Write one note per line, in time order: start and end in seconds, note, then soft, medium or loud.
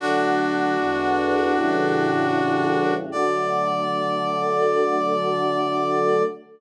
0.00 0.77 D3 medium
0.00 0.77 F#3 medium
0.00 0.77 A3 medium
0.00 2.93 D4 medium
0.00 2.93 F#4 loud
0.78 1.55 E2 medium
0.78 1.55 D3 medium
0.78 1.55 G#3 medium
0.78 1.55 B3 medium
1.55 3.09 A2 medium
1.55 3.09 C#3 medium
1.55 3.09 E3 medium
1.55 3.09 G3 medium
3.12 6.23 D3 medium
3.12 6.23 F#3 medium
3.12 6.23 A3 medium
3.12 6.23 D5 loud